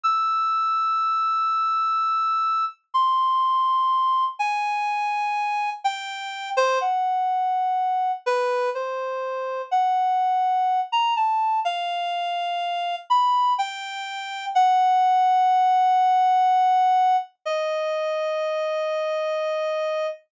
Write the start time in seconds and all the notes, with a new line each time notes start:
0.03 E6
2.94 C6
4.39 G#5
5.84 G5
6.57 C5
6.81 F#5
8.26 B4
8.75 C5
9.71 F#5
10.92 A#5
11.16 A5
11.65 F5
13.10 B5
13.58 G5
14.55 F#5
17.45 D#5